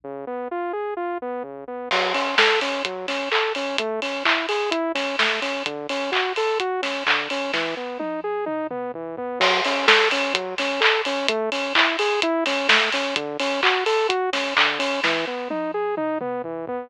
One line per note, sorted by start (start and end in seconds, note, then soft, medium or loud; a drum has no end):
0.04 0.25 C#3 medium
0.27 0.48 B3 medium
0.51 0.72 F4 medium
0.73 0.94 G#4 medium
0.97 1.18 F4 medium
1.22 1.43 B3 medium
1.43 1.64 C#3 medium
1.68 1.89 B3 medium
1.91 2.13 F#3 loud
1.91 kick loud
1.91 crash loud
2.14 2.35 C#4 medium
2.14 open hi-hat medium
2.38 2.60 A4 medium
2.38 kick loud
2.38 snare loud
2.61 2.83 C#4 medium
2.61 open hi-hat medium
2.85 3.06 F#3 medium
2.85 kick loud
2.85 closed hi-hat loud
3.08 3.29 C#4 medium
3.08 snare medium
3.08 open hi-hat medium
3.32 3.53 A4 medium
3.32 clap loud
3.55 3.77 C#4 medium
3.55 open hi-hat medium
3.78 4.00 A3 loud
3.78 kick loud
3.78 closed hi-hat loud
4.02 4.23 C#4 medium
4.02 open hi-hat medium
4.25 4.46 E4 medium
4.25 kick loud
4.25 clap loud
4.49 4.70 G#4 medium
4.49 open hi-hat medium
4.71 4.92 E4 medium
4.71 kick loud
4.71 closed hi-hat loud
4.95 5.16 C#4 medium
4.95 snare medium
4.95 open hi-hat medium
5.19 5.40 A3 medium
5.19 kick loud
5.19 snare loud
5.42 5.63 C#4 medium
5.42 open hi-hat medium
5.66 5.87 D3 medium
5.66 kick loud
5.66 closed hi-hat loud
5.89 6.11 C#4 medium
5.89 open hi-hat medium
6.12 6.33 F#4 medium
6.12 kick loud
6.12 clap loud
6.36 6.58 A4 medium
6.36 open hi-hat medium
6.60 6.81 F#4 medium
6.60 kick loud
6.60 closed hi-hat loud
6.82 7.03 C#4 medium
6.82 snare medium
6.82 open hi-hat medium
7.07 7.28 D3 medium
7.07 kick loud
7.07 clap loud
7.30 7.52 C#4 medium
7.30 open hi-hat medium
7.53 7.75 E3 loud
7.53 kick medium
7.53 snare medium
7.77 7.98 B3 medium
7.99 8.20 D#4 medium
7.99 high tom medium
8.24 8.45 G#4 medium
8.46 8.67 D#4 medium
8.46 mid tom loud
8.71 8.92 B3 medium
8.71 mid tom loud
8.94 9.16 E3 medium
8.94 floor tom loud
9.17 9.39 B3 medium
9.17 floor tom loud
9.40 9.61 F#3 loud
9.40 kick loud
9.40 crash loud
9.65 9.86 C#4 medium
9.65 open hi-hat loud
9.87 10.08 A4 medium
9.87 kick loud
9.87 snare loud
10.11 10.33 C#4 medium
10.11 open hi-hat loud
10.34 10.55 F#3 medium
10.34 kick loud
10.34 closed hi-hat loud
10.58 10.80 C#4 medium
10.58 snare medium
10.58 open hi-hat loud
10.80 11.01 A4 medium
10.80 clap loud
11.05 11.27 C#4 medium
11.05 open hi-hat loud
11.28 11.50 A3 loud
11.28 kick loud
11.28 closed hi-hat loud
11.52 11.73 C#4 medium
11.52 open hi-hat loud
11.75 11.96 E4 medium
11.75 kick loud
11.75 clap loud
11.99 12.20 G#4 medium
11.99 open hi-hat loud
12.22 12.44 E4 loud
12.22 kick loud
12.22 closed hi-hat loud
12.46 12.67 C#4 medium
12.46 snare medium
12.46 open hi-hat loud
12.68 12.90 A3 medium
12.68 kick loud
12.68 snare loud
12.92 13.15 C#4 medium
12.92 open hi-hat loud
13.16 13.37 D3 loud
13.16 kick loud
13.16 closed hi-hat loud
13.40 13.61 C#4 medium
13.40 open hi-hat loud
13.63 13.84 F#4 medium
13.63 kick loud
13.63 clap loud
13.86 14.07 A4 medium
13.86 open hi-hat loud
14.09 14.30 F#4 medium
14.09 kick loud
14.09 closed hi-hat loud
14.33 14.54 C#4 medium
14.33 snare medium
14.33 open hi-hat loud
14.57 14.78 D3 medium
14.57 kick loud
14.57 clap loud
14.79 15.00 C#4 medium
14.79 open hi-hat loud
15.04 15.25 E3 loud
15.04 kick medium
15.04 snare loud
15.27 15.48 B3 medium
15.50 15.71 D#4 medium
15.50 high tom loud
15.74 15.95 G#4 medium
15.97 16.18 D#4 medium
15.97 mid tom loud
16.21 16.42 B3 medium
16.21 mid tom loud
16.44 16.66 E3 medium
16.44 floor tom loud
16.67 16.89 B3 medium
16.67 floor tom loud